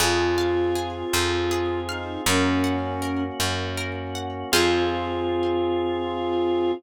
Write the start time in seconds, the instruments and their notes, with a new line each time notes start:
0.00 electric bass (finger) F2, drawbar organ C4 F4 G#4, flute F4, orchestral harp G#4
0.38 orchestral harp F5
0.75 orchestral harp G#4
1.13 electric bass (finger) F2, orchestral harp C5
1.51 orchestral harp G#4
1.89 flute D#4, orchestral harp F5
2.26 electric bass (finger) F#2, drawbar organ A#3 C#4 F#4, flute C#4, orchestral harp A#4
2.64 orchestral harp F#5
3.02 orchestral harp A#4
3.40 electric bass (finger) F#2, orchestral harp C#5
3.77 orchestral harp A#4
4.15 orchestral harp F#5
4.52 electric bass (finger) F2, drawbar organ C4 F4 G#4, flute F4, orchestral harp G#4 C5 F5